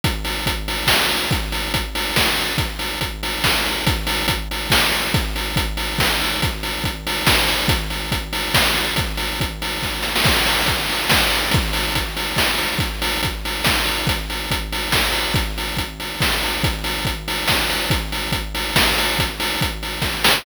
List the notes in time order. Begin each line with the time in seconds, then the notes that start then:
0.04 kick, closed hi-hat
0.24 open hi-hat
0.46 kick, closed hi-hat
0.68 open hi-hat
0.87 kick, snare
1.09 open hi-hat
1.31 kick, closed hi-hat
1.52 open hi-hat
1.74 kick, closed hi-hat
1.95 open hi-hat
2.16 kick, snare
2.37 open hi-hat
2.58 kick, closed hi-hat
2.79 open hi-hat
3.01 kick, closed hi-hat
3.23 open hi-hat
3.44 kick, snare
3.66 open hi-hat
3.86 kick, closed hi-hat
4.07 open hi-hat
4.28 kick, closed hi-hat
4.51 open hi-hat
4.70 kick, snare
4.91 open hi-hat
5.14 kick, closed hi-hat
5.36 open hi-hat
5.56 kick, closed hi-hat
5.77 open hi-hat
5.98 kick, snare
6.21 open hi-hat
6.42 kick, closed hi-hat
6.63 open hi-hat
6.84 kick, closed hi-hat
7.07 open hi-hat
7.27 kick, snare
7.48 open hi-hat
7.68 kick, closed hi-hat
7.90 open hi-hat
8.12 kick, closed hi-hat
8.33 open hi-hat
8.54 kick, snare
8.75 open hi-hat
8.96 kick, closed hi-hat
9.17 open hi-hat
9.40 kick, closed hi-hat
9.62 open hi-hat
9.82 kick, snare
10.02 snare
10.16 snare
10.24 kick, crash
10.46 open hi-hat
10.66 kick, closed hi-hat
10.89 open hi-hat
11.09 kick, snare
11.30 open hi-hat
11.51 kick, closed hi-hat
11.73 open hi-hat
11.95 kick, closed hi-hat
12.17 open hi-hat
12.36 kick, snare
12.58 open hi-hat
12.78 kick, closed hi-hat
13.02 open hi-hat
13.23 kick, closed hi-hat
13.45 open hi-hat
13.64 kick, snare
13.86 open hi-hat
14.07 kick, closed hi-hat
14.30 open hi-hat
14.51 kick, closed hi-hat
14.72 open hi-hat
14.92 kick, snare
15.12 open hi-hat
15.34 kick, closed hi-hat
15.58 open hi-hat
15.77 kick, closed hi-hat
16.00 open hi-hat
16.20 kick, snare
16.43 open hi-hat
16.63 kick, closed hi-hat
16.84 open hi-hat
17.05 kick, closed hi-hat
17.28 open hi-hat
17.48 kick, snare
17.70 open hi-hat
17.90 kick, closed hi-hat
18.12 open hi-hat
18.32 kick, closed hi-hat
18.55 open hi-hat
18.76 kick, snare
18.98 open hi-hat
19.19 kick, closed hi-hat
19.40 open hi-hat
19.61 kick, closed hi-hat
19.83 open hi-hat
20.02 kick, snare
20.24 snare